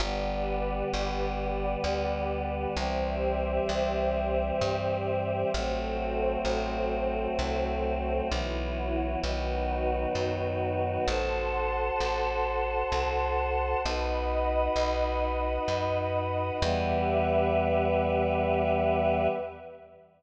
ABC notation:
X:1
M:3/4
L:1/8
Q:1/4=65
K:Em
V:1 name="Choir Aahs"
[D,G,B,]6 | [E,G,C]6 | [F,A,C]6 | [E,F,B,]2 [^D,F,B,]4 |
[FAc]6 | [^DFB]6 | [E,G,B,]6 |]
V:2 name="Pad 2 (warm)"
[GBd]6 | [Gce]6 | [FAc]6 | [EFB]2 [^DFB]4 |
[fac']6 | [^dfb]6 | [GBe]6 |]
V:3 name="Electric Bass (finger)" clef=bass
G,,,2 G,,,2 D,,2 | C,,2 C,,2 G,,2 | A,,,2 A,,,2 C,,2 | B,,,2 B,,,2 F,,2 |
A,,,2 A,,,2 C,,2 | B,,,2 B,,,2 F,,2 | E,,6 |]